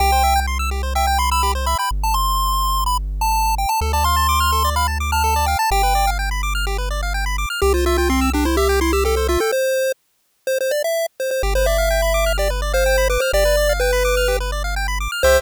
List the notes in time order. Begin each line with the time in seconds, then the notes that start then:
0.00 C2 G4 G5
0.12 C5
0.24 E5
0.36 G5
0.47 C6
0.59 E6
0.71 G4
0.83 C5
0.95 E5 G5
1.07 G5
1.18 B5 C6
1.31 B5 E6
1.43 G4
1.55 C5
1.66 E5 B5
1.78 G5 B5
1.91 G1
2.03 A5
2.14 C6
2.86 B5
3.21 A5
3.58 G5
3.69 A5
3.81 D2 A4
3.93 D5 A5
4.04 F5 C6
4.16 A5
4.29 D6
4.40 F6
4.52 A4
4.64 D5
4.76 F5 B5
4.88 A5
5.00 D6
5.12 A5 F6
5.24 A4
5.36 D5
5.46 F5 G5
5.59 A5
5.71 G1 G4 G5
5.83 B4
5.95 D5
6.07 F5
6.19 G5
6.31 B5
6.43 D6
6.55 F6
6.67 G4
6.78 B4
6.91 D5
7.03 F5
7.14 G5
7.26 B5
7.38 D6
7.50 F6
7.62 C2 G4
7.74 F4 C5
7.86 F4 E5
7.98 F4 G5
8.10 C4 C6
8.21 E6
8.33 D4 G4
8.45 E4 C5
8.57 G4 E5
8.69 G5
8.81 E4 C6
8.93 G4 E6
9.05 G4 A4
9.16 A4 C5
9.28 F4 E5
9.40 A4 G5
9.52 C5
10.47 C5
10.61 C5
10.71 D5
10.84 E5
11.20 C5
11.31 C5
11.43 G1 G4
11.55 B4 C5
11.66 D5 E5
11.78 F5
11.91 G5
12.02 B5
12.14 D6
12.26 F6
12.38 G4 D5
12.50 B4
12.62 D5
12.73 C5 F5
12.86 G5
12.98 B5
13.10 B4 D6
13.20 C5 F6
13.33 G1 G4 D5
13.45 B4
13.57 D5
13.69 F5
13.80 B4 G5
13.93 B5
14.05 D6
14.17 F6
14.28 G4
14.40 B4
14.52 D5
14.64 F5
14.76 G5
14.88 B5
15.00 D6
15.12 F6
15.23 C2 G4 C5 E5